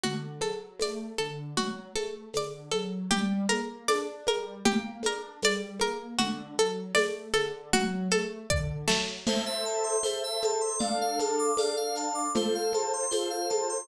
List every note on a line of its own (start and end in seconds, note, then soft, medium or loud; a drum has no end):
0.03 0.38 D3 medium
0.03 0.39 F#4 medium
0.03 low conga loud
0.03 shaker medium
0.41 0.77 F#3 medium
0.41 0.77 A4 medium
0.41 high conga medium
0.41 shaker medium
0.79 1.15 A3 medium
0.79 1.17 D5 medium
0.79 tambourine medium
0.79 high conga medium
0.79 shaker medium
1.18 1.54 D3 medium
1.18 1.54 A4 medium
1.18 shaker medium
1.57 1.92 F#3 medium
1.57 1.92 F#4 medium
1.57 low conga loud
1.57 shaker medium
1.96 2.31 A3 medium
1.96 2.31 A4 medium
1.96 high conga medium
1.96 shaker medium
2.33 2.69 D3 medium
2.33 2.72 D5 medium
2.33 tambourine medium
2.33 high conga medium
2.33 shaker medium
2.71 3.08 F#3 medium
2.71 3.07 A4 medium
2.71 high conga medium
2.71 shaker medium
3.10 3.46 G3 medium
3.10 3.46 G4 medium
3.10 low conga loud
3.10 shaker medium
3.49 3.85 A#3 medium
3.49 3.84 A#4 medium
3.49 high conga medium
3.49 shaker medium
3.88 4.23 D4 medium
3.88 4.24 D5 loud
3.88 tambourine medium
3.88 high conga loud
3.88 shaker medium
4.26 4.62 G3 medium
4.26 4.63 A#4 medium
4.26 high conga medium
4.26 shaker medium
4.65 5.00 A#3 medium
4.65 5.01 G4 medium
4.65 low conga loud
4.65 shaker medium
5.03 5.38 D4 medium
5.03 5.42 A#4 medium
5.03 high conga medium
5.03 shaker medium
5.42 5.77 G3 medium
5.42 5.80 D5 loud
5.42 tambourine loud
5.42 high conga loud
5.42 shaker loud
5.79 6.15 A#3 medium
5.79 6.17 A#4 medium
5.79 high conga medium
5.79 shaker medium
6.18 6.54 D3 medium
6.18 6.54 F#4 loud
6.18 low conga loud
6.18 shaker medium
6.58 6.92 F#3 medium
6.58 6.94 A4 medium
6.58 shaker medium
6.95 7.31 A3 medium
6.95 7.30 D5 loud
6.95 tambourine loud
6.95 high conga loud
6.95 shaker loud
7.34 7.69 D3 medium
7.34 7.69 A4 medium
7.34 high conga medium
7.34 shaker medium
7.73 8.08 F#3 medium
7.73 8.09 F#4 loud
7.73 low conga loud
7.73 shaker medium
8.11 8.46 A3 medium
8.11 8.47 A4 medium
8.11 high conga medium
8.11 shaker medium
8.50 8.85 D3 medium
8.50 8.85 D5 loud
8.50 kick medium
8.88 9.23 F#3 medium
8.88 9.23 A3 medium
8.88 snare loud
9.26 9.96 A4 medium
9.26 9.44 C5 medium
9.26 9.96 C5 medium
9.26 9.96 E5 medium
9.26 crash loud
9.26 low conga loud
9.26 shaker medium
9.46 9.64 E5 medium
9.65 9.83 A5 medium
9.65 shaker medium
9.84 10.01 C6 medium
10.03 10.73 A4 medium
10.03 10.21 C5 medium
10.03 10.73 C5 medium
10.03 10.73 E5 medium
10.03 tambourine loud
10.03 high conga medium
10.03 shaker medium
10.23 10.41 E5 medium
10.42 10.62 A5 medium
10.42 high conga medium
10.42 shaker medium
10.61 10.79 C6 medium
10.79 11.50 D4 medium
10.79 11.50 A4 medium
10.79 10.97 D5 medium
10.79 11.50 F5 medium
10.79 low conga loud
10.79 shaker medium
11.01 11.19 F5 medium
11.19 11.38 A5 medium
11.19 high conga medium
11.19 shaker medium
11.39 11.57 D6 medium
11.57 12.27 D4 medium
11.57 12.27 A4 medium
11.57 11.75 D5 medium
11.57 12.27 F5 medium
11.57 tambourine loud
11.57 high conga medium
11.57 shaker medium
11.77 11.95 F5 medium
11.95 12.14 A5 medium
11.95 shaker medium
12.15 12.32 D6 medium
12.34 13.04 F4 medium
12.34 13.04 A4 medium
12.34 13.04 C5 medium
12.34 12.54 C5 medium
12.34 low conga loud
12.34 shaker loud
12.55 12.73 F5 medium
12.73 12.92 A5 medium
12.73 high conga medium
12.73 shaker medium
12.93 13.11 C6 medium
13.11 13.81 F4 medium
13.11 13.81 A4 medium
13.11 13.28 C5 medium
13.11 13.81 C5 medium
13.11 tambourine loud
13.11 high conga medium
13.11 shaker medium
13.30 13.48 F5 medium
13.50 13.67 A5 medium
13.50 high conga medium
13.50 shaker medium
13.69 13.87 C6 medium